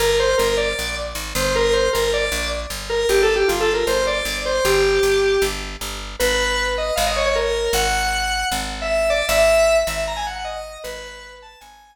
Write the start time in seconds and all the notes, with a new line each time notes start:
0.00 G1 A#4
0.20 C5
0.38 G1 A#4
0.57 D5
0.79 A#1
1.15 G#1
1.35 G1 C5
1.55 A#4
1.73 C5
1.93 G1 A#4
2.14 D5
2.32 A#1
2.70 G1
2.90 A#4
3.09 G1 G4
3.23 A4
3.36 G4
3.48 G1 F4
3.60 A4
3.74 A#4
3.87 G1 C5
4.07 D5
4.25 G1
4.46 C5
4.65 G1 G4
5.03 G1
5.42 G1
5.81 G1
6.20 G#1 B4
6.78 D#5
6.96 G#1 F5
7.07 D#5
7.16 C#5
7.26 C#5
7.35 A#4
7.73 G#1 F#5
8.52 G#1
8.82 E5
9.10 D5
9.29 G#1 E5
9.87 G#1 E5
10.08 A#5
10.17 G#5
10.27 F#5
10.36 F#5
10.45 D#5
10.84 G#1 B4
11.42 A5
11.61 G#1 G#5